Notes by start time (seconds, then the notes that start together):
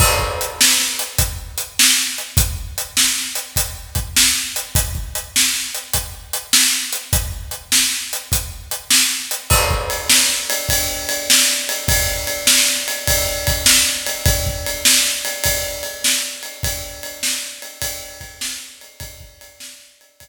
0.00 kick, crash
0.19 kick
0.41 closed hi-hat
0.61 snare
0.80 snare
0.99 closed hi-hat
1.18 kick, closed hi-hat
1.58 closed hi-hat
1.79 snare
2.18 closed hi-hat
2.37 kick, closed hi-hat
2.78 closed hi-hat
2.97 snare
3.18 snare
3.35 closed hi-hat
3.56 kick, closed hi-hat
3.95 kick, closed hi-hat
4.16 snare
4.56 closed hi-hat
4.75 kick, closed hi-hat
4.95 kick
5.15 closed hi-hat
5.36 snare
5.54 snare
5.75 closed hi-hat
5.93 kick, closed hi-hat
6.33 closed hi-hat
6.53 snare
6.93 closed hi-hat
7.13 kick, closed hi-hat
7.51 closed hi-hat
7.72 snare
7.91 snare
8.13 closed hi-hat
8.32 kick, closed hi-hat
8.71 closed hi-hat
8.90 snare
9.31 closed hi-hat
9.50 kick, crash
9.71 kick
9.90 ride
10.10 snare
10.29 snare
10.50 ride
10.69 kick, ride
11.09 ride
11.30 snare
11.69 ride
11.88 kick, ride
12.27 ride
12.47 snare
12.67 snare
12.88 ride
13.07 kick, ride
13.47 kick, ride
13.66 snare
14.07 ride
14.26 kick, ride
14.46 kick
14.66 ride
14.85 snare
15.05 snare
15.25 ride
15.44 kick, ride
15.83 ride
16.04 snare
16.43 ride
16.63 kick, ride
17.03 ride
17.23 snare
17.43 snare
17.62 ride
17.82 kick, ride
18.21 kick, ride
18.41 snare
18.81 ride
19.00 kick, ride
19.20 kick
19.41 ride
19.60 snare
19.80 snare
20.01 ride
20.20 kick, ride